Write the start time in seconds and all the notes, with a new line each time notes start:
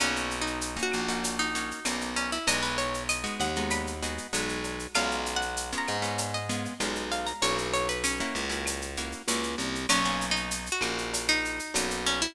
0.00 B1 A#3 C#4 D#4 F#4, cowbell, claves, shaker
0.16 shaker
0.31 shaker
0.41 D#4
0.47 shaker
0.61 shaker
0.77 A#3 C#4 D#4 F#4, shaker
0.83 F#4
0.92 A#1, claves, shaker
1.08 A#3 C#4 D#4 F#4, shaker
1.23 cowbell, shaker
1.39 D#4, shaker
1.55 A#3 C#4 D#4 F#4, shaker
1.71 shaker
1.85 B1 A#3 C#4 D#4 F#4, cowbell, claves, shaker
2.01 shaker
2.16 C#4, cowbell, shaker
2.32 E4, shaker
2.47 B1 G#3 B3 D#4 F#4 D#5, cowbell, shaker
2.63 B4, shaker
2.78 C#5, shaker
2.94 shaker
3.09 D#5, claves, shaker
3.24 G#3 B3 D#4 F#4, shaker
3.40 D#2 F#5, shaker
3.56 G#3 B3 D#4 F#4, shaker
3.70 B5, cowbell, claves, shaker
3.87 shaker
4.02 G#3 B3 D#4 F#4, shaker
4.18 shaker
4.33 B1 G#3 B3 D#4 F#4, cowbell, shaker
4.49 shaker
4.64 cowbell, shaker
4.79 shaker
4.94 B1 G#3 B3 C#4 F4 F5, cowbell, claves, shaker
5.11 shaker
5.26 shaker
5.36 F#5
5.41 shaker
5.57 shaker
5.72 G#3 B3 C#4 F4, shaker
5.78 A#5
5.87 G#2, claves, shaker
6.02 G#3 B3 C#4 F4, shaker
6.18 cowbell, shaker
6.34 D#5, shaker
6.49 G#3 B3 C#4 F4, shaker
6.65 shaker
6.80 B1 G#3 B3 C#4 F4, cowbell, claves, shaker
6.95 shaker
7.11 F5, cowbell, shaker
7.27 A#5, shaker
7.42 B1 A#3 C#4 E4 F#4 C#5, cowbell, shaker
7.58 shaker
7.73 C#5, shaker
7.89 B4, shaker
8.04 C#4, claves, shaker
8.20 A#3 C#4 E4 F#4, shaker
8.35 C#2, shaker
8.49 A#3 C#4 E4 F#4, shaker
8.66 cowbell, claves, shaker
8.82 shaker
8.97 A#3 C#4 E4 F#4, shaker
9.12 shaker
9.28 C#2 A#3 C#4 E4 F#4, cowbell, shaker
9.43 shaker
9.58 C2, cowbell, shaker
9.75 shaker
9.89 B1 A#3 C#4 D#4 F#4, cowbell, claves, shaker
10.05 A#3 C#4 D#4 F#4, shaker
10.21 shaker
10.31 D#4
10.36 shaker
10.51 shaker
10.66 shaker
10.72 F#4
10.81 A#1 A#3 C#4 D#4 F#4, claves, shaker
10.98 shaker
11.14 cowbell, shaker
11.28 D#4, shaker
11.45 shaker
11.59 shaker
11.74 B1 A#3 C#4 D#4 F#4, cowbell, claves, shaker
11.90 shaker
12.06 C#4, cowbell, shaker
12.22 E4, shaker